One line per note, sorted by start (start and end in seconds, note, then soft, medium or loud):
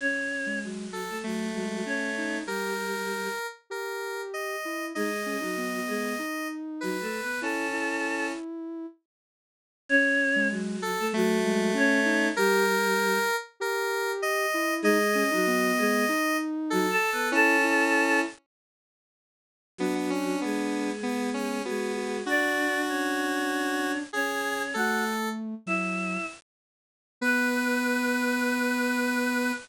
0.01 0.59 C#4 medium
0.01 0.59 C#5 medium
0.46 0.87 G#3 medium
0.64 1.08 F#3 medium
0.64 1.08 F#4 medium
0.93 1.18 A4 medium
1.09 1.23 A3 medium
1.09 1.23 A4 medium
1.24 1.82 F#3 medium
1.24 2.39 A3 medium
1.24 1.49 A3 medium
1.24 1.82 F#4 medium
1.55 1.82 G#3 medium
1.86 2.12 C#4 medium
1.86 2.37 C#4 medium
1.86 2.37 C#5 medium
2.17 2.44 D#4 medium
2.46 3.28 G3 medium
2.46 3.28 G4 medium
2.46 2.74 G4 medium
2.46 3.47 A#4 medium
3.70 4.56 G4 medium
3.70 4.21 A#4 medium
4.34 4.86 D#5 medium
4.65 4.92 E4 medium
4.95 5.36 G#3 medium
4.95 5.10 D#4 medium
4.95 5.36 G#4 medium
4.95 6.48 D#5 medium
5.26 5.41 C#4 medium
5.41 5.80 F#3 medium
5.41 5.55 D#4 medium
5.41 5.80 F#4 medium
5.57 6.16 B3 medium
5.87 6.14 G#3 medium
5.87 6.14 G#4 medium
6.19 6.97 D#4 medium
6.81 7.02 F#3 medium
6.81 7.02 F#4 medium
6.81 7.39 B4 medium
7.01 7.20 A3 medium
7.01 7.20 A4 medium
7.22 7.41 B3 medium
7.22 7.41 B4 medium
7.41 8.32 C#4 medium
7.41 7.66 E4 medium
7.41 8.27 A4 medium
7.41 8.27 A5 medium
7.73 8.86 E4 medium
9.89 10.48 C#4 loud
9.89 10.48 C#5 loud
10.36 10.77 G#3 medium
10.51 10.95 F#3 medium
10.51 10.95 F#4 loud
10.82 11.07 A4 loud
10.99 11.13 A3 medium
10.99 11.13 A4 loud
11.13 11.73 F#3 loud
11.13 11.38 A3 medium
11.13 12.29 A3 loud
11.13 11.73 F#4 loud
11.44 11.71 G#3 medium
11.74 12.00 C#4 medium
11.74 12.27 C#4 loud
11.74 12.27 C#5 loud
12.05 12.31 D#4 medium
12.36 13.19 G3 loud
12.36 13.19 G4 loud
12.36 12.65 G4 medium
12.36 13.36 A#4 loud
13.60 14.46 G4 medium
13.60 14.11 A#4 loud
14.22 14.74 D#5 loud
14.54 14.81 E4 medium
14.82 15.23 G#3 loud
14.82 14.98 D#4 loud
14.82 15.23 G#4 loud
14.82 16.37 D#5 loud
15.15 15.30 C#4 medium
15.31 15.72 F#3 loud
15.31 15.46 D#4 medium
15.31 15.72 F#4 loud
15.47 16.06 B3 medium
15.78 16.05 G#3 loud
15.78 16.05 G#4 loud
16.09 16.86 D#4 medium
16.70 16.91 F#3 loud
16.70 16.91 F#4 loud
16.70 17.29 A4 loud
16.90 17.10 A4 loud
16.90 17.10 A5 loud
17.12 17.32 B3 medium
17.12 17.32 B4 loud
17.32 18.21 C#4 loud
17.32 17.56 E4 loud
17.32 18.19 A4 loud
17.32 18.19 A5 loud
17.64 18.25 E4 medium
19.78 20.36 F#3 medium
19.78 19.94 B3 medium
19.78 20.90 D4 medium
19.78 20.36 F#4 medium
19.95 20.10 B3 medium
20.10 20.40 C#4 medium
20.41 21.61 G#3 medium
20.41 20.92 B3 medium
20.41 21.61 G#4 medium
21.03 21.30 B3 medium
21.03 21.59 B3 medium
21.34 21.62 C#4 medium
21.65 22.23 G#3 medium
21.65 22.17 B3 medium
21.65 21.92 F#4 medium
21.65 22.23 G#4 medium
21.97 22.23 F#4 medium
22.26 24.02 D4 medium
22.26 22.81 D4 loud
22.26 23.91 F#4 loud
22.26 22.81 D5 loud
22.89 23.98 C#4 medium
22.89 23.98 C#5 medium
24.13 24.73 C#4 medium
24.13 24.63 G#4 loud
24.13 24.73 C#5 medium
24.74 25.55 A3 medium
24.74 25.04 F#4 medium
24.74 25.29 A4 loud
24.74 25.04 F#5 medium
25.66 26.17 F#3 medium
25.66 26.26 E4 medium
25.66 26.26 E5 medium
27.21 29.52 B3 loud
27.21 29.52 B4 loud
27.21 29.54 B4 loud